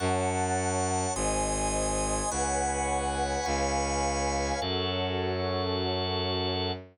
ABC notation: X:1
M:4/4
L:1/8
Q:1/4=104
K:F#m
V:1 name="String Ensemble 1"
[cfa]4 [^B^dg]4 | [Bcfg]4 [Bc^eg]4 | [CFA]8 |]
V:2 name="Drawbar Organ"
[fac']4 [g^b^d']4 | [fgbc']4 [^egbc']4 | [FAc]8 |]
V:3 name="Violin" clef=bass
F,,4 G,,,4 | C,,4 C,,4 | F,,8 |]